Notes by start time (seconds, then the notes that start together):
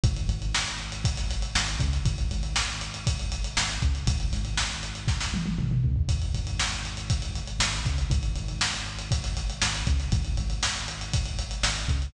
0.03 G#1, kick, closed hi-hat
0.16 closed hi-hat
0.29 G#1, closed hi-hat
0.42 closed hi-hat
0.55 snare
0.68 closed hi-hat
0.80 closed hi-hat
0.92 closed hi-hat
1.04 kick, closed hi-hat
1.17 snare, closed hi-hat
1.30 snare, closed hi-hat
1.42 closed hi-hat
1.55 G#1, snare
1.68 closed hi-hat
1.79 C#2, kick, closed hi-hat
1.93 snare, closed hi-hat
2.05 G#1, kick, closed hi-hat
2.18 closed hi-hat
2.31 G#1, closed hi-hat
2.43 closed hi-hat
2.56 snare
2.68 snare, closed hi-hat
2.81 closed hi-hat
2.94 closed hi-hat
3.07 kick, closed hi-hat
3.19 closed hi-hat
3.32 closed hi-hat
3.44 closed hi-hat
3.57 G#1, snare
3.69 closed hi-hat
3.82 C#2, kick, closed hi-hat
3.95 closed hi-hat
4.07 G#1, kick, closed hi-hat
4.20 closed hi-hat
4.32 G#1, snare, closed hi-hat
4.45 closed hi-hat
4.57 snare
4.71 closed hi-hat
4.83 closed hi-hat
4.95 closed hi-hat
5.08 kick, snare
5.20 snare
5.34 high tom
5.46 high tom
5.58 G#1, mid tom
5.71 mid tom
5.84 C#2, floor tom
5.96 floor tom
6.09 G#1, kick, closed hi-hat
6.22 closed hi-hat
6.34 G#1, closed hi-hat
6.47 closed hi-hat
6.59 snare
6.72 closed hi-hat
6.85 closed hi-hat
6.97 closed hi-hat
7.10 kick, closed hi-hat
7.22 closed hi-hat
7.36 closed hi-hat
7.47 closed hi-hat
7.59 G#1, snare
7.73 closed hi-hat
7.85 C#2, kick, snare, closed hi-hat
7.98 closed hi-hat
8.10 G#1, kick, closed hi-hat
8.23 closed hi-hat
8.36 G#1, closed hi-hat
8.48 closed hi-hat
8.61 snare
8.73 closed hi-hat
8.86 closed hi-hat
8.99 closed hi-hat
9.11 kick, closed hi-hat
9.24 snare, closed hi-hat
9.37 snare, closed hi-hat
9.50 closed hi-hat
9.62 G#1, snare
9.75 closed hi-hat
9.87 C#2, kick, closed hi-hat
10.00 snare, closed hi-hat
10.12 G#1, kick, closed hi-hat
10.25 closed hi-hat
10.37 G#1, closed hi-hat
10.50 closed hi-hat
10.63 snare
10.76 snare, closed hi-hat
10.88 closed hi-hat
11.01 closed hi-hat
11.14 kick, closed hi-hat
11.26 closed hi-hat
11.39 closed hi-hat
11.51 closed hi-hat
11.63 G#1, snare
11.76 closed hi-hat
11.88 C#2, kick, closed hi-hat
12.02 closed hi-hat